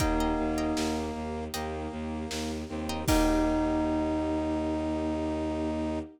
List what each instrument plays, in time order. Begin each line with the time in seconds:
0.00 violin D#2, string ensemble 1 A#3 D#4 G4, brass section A#3, tubular bells D#4, orchestral harp D#5 G5 A#5, kick, closed hi-hat
0.20 orchestral harp D#5 G5 A#5
0.39 violin D#2
0.58 orchestral harp D#5 G5 A#5
0.77 violin D#2, snare
1.15 violin D#2
1.54 violin D#2, brass section A#3, orchestral harp D#5 G5 A#5, closed hi-hat
1.92 violin D#2
2.31 violin D#2, snare
2.69 violin D#2, brass section C4
2.89 orchestral harp D#5 G5 A#5
3.08 violin D#2, string ensemble 1 A#3 D#4 G4, brass section D#4, orchestral harp D#4 G4 A#4, tubular bells D#4, kick, crash